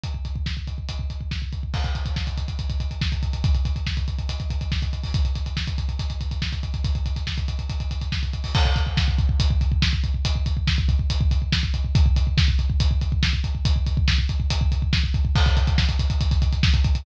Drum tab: CC |----------------|x---------------|----------------|----------------|
HH |x-x---x-x-x---x-|-xxx-xxxxxxx-xxx|xxxx-xxxxxxx-xxo|xxxx-xxxxxxx-xxx|
SD |----o-------o---|----o-------o---|----o-------o---|----o-------o---|
BD |oooooooooooooooo|oooooooooooooooo|oooooooooooooooo|oooooooooooooooo|

CC |----------------|x---------------|----------------|----------------|
HH |xxxx-xxxxxxx-xxo|--x---x-x-x---x-|x-x---x-x-x---x-|x-x---x-x-x---x-|
SD |----o-------o---|----o-------o---|----o-------o---|----o-------o---|
BD |oooooooooooooooo|oooooooooooooooo|oooooooooooooooo|oooooooooooooooo|

CC |----------------|x---------------|
HH |x-x---x-x-x---x-|-xxx-xxxxxxx-xxx|
SD |----o-------o---|----o-------o---|
BD |oooooooooooooooo|oooooooooooooooo|